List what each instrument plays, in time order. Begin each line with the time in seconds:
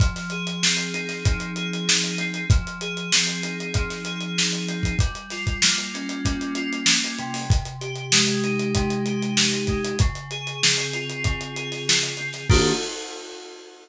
0.00 electric piano 2 F3, kick, closed hi-hat
0.16 snare, closed hi-hat
0.30 electric piano 2 G#4, closed hi-hat
0.47 closed hi-hat
0.62 electric piano 2 C4, snare
0.77 closed hi-hat
0.94 electric piano 2 D#4, closed hi-hat
1.09 snare, closed hi-hat
1.25 electric piano 2 F3, kick, closed hi-hat
1.40 closed hi-hat
1.56 electric piano 2 G#4, closed hi-hat
1.73 closed hi-hat
1.88 electric piano 2 D#4, snare
2.04 closed hi-hat
2.18 electric piano 2 C4, closed hi-hat
2.34 closed hi-hat
2.50 electric piano 2 F3, kick, closed hi-hat
2.67 closed hi-hat
2.81 electric piano 2 G#4, closed hi-hat
2.97 closed hi-hat
3.12 electric piano 2 C4, snare
3.27 closed hi-hat
3.43 electric piano 2 D#4, closed hi-hat
3.60 closed hi-hat
3.74 electric piano 2 F3, kick, closed hi-hat
3.90 snare, closed hi-hat
4.05 electric piano 2 G#4, closed hi-hat
4.21 closed hi-hat
4.38 electric piano 2 D#4, snare
4.53 closed hi-hat
4.68 electric piano 2 C4, closed hi-hat
4.83 kick, closed hi-hat
4.99 electric piano 2 G3, kick, closed hi-hat
5.15 closed hi-hat
5.30 electric piano 2 F4, snare, closed hi-hat
5.47 kick, closed hi-hat
5.62 electric piano 2 A#3, snare
5.78 closed hi-hat
5.94 electric piano 2 C#4, closed hi-hat
6.09 closed hi-hat
6.25 electric piano 2 G3, kick, closed hi-hat
6.41 closed hi-hat
6.55 electric piano 2 F4, closed hi-hat
6.73 closed hi-hat
6.86 electric piano 2 C#4, snare
7.04 closed hi-hat
7.18 electric piano 2 C3, closed hi-hat
7.34 open hi-hat
7.50 kick, closed hi-hat
7.65 closed hi-hat
7.81 electric piano 2 G4, closed hi-hat
7.96 closed hi-hat
8.12 electric piano 2 G#3, snare
8.27 closed hi-hat
8.44 electric piano 2 D#4, closed hi-hat
8.60 closed hi-hat
8.75 electric piano 2 C3, kick, closed hi-hat
8.90 closed hi-hat
9.06 electric piano 2 G4, closed hi-hat
9.23 closed hi-hat
9.37 electric piano 2 D#4, snare
9.52 snare, closed hi-hat
9.67 electric piano 2 G#3, kick, closed hi-hat
9.85 closed hi-hat
9.99 electric piano 2 C#3, kick, closed hi-hat
10.15 closed hi-hat
10.31 electric piano 2 G#4, closed hi-hat
10.47 closed hi-hat
10.63 electric piano 2 C4, snare
10.78 snare, closed hi-hat
10.93 electric piano 2 F4, closed hi-hat
11.10 closed hi-hat
11.24 electric piano 2 C#3, kick, closed hi-hat
11.41 closed hi-hat
11.56 electric piano 2 G#4, closed hi-hat
11.72 snare, closed hi-hat
11.87 electric piano 2 F4, snare
12.03 snare, closed hi-hat
12.17 electric piano 2 C4, closed hi-hat
12.33 snare, closed hi-hat
12.50 electric piano 2 D#3 A#3 D4 G4, kick, crash